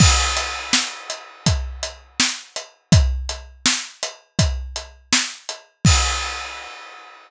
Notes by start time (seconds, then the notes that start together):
0.00 kick, crash
0.37 closed hi-hat
0.73 snare
1.10 closed hi-hat
1.46 kick, closed hi-hat
1.83 closed hi-hat
2.20 snare
2.56 closed hi-hat
2.92 kick, closed hi-hat
3.29 closed hi-hat
3.66 snare
4.03 closed hi-hat
4.39 kick, closed hi-hat
4.76 closed hi-hat
5.13 snare
5.49 closed hi-hat
5.85 kick, crash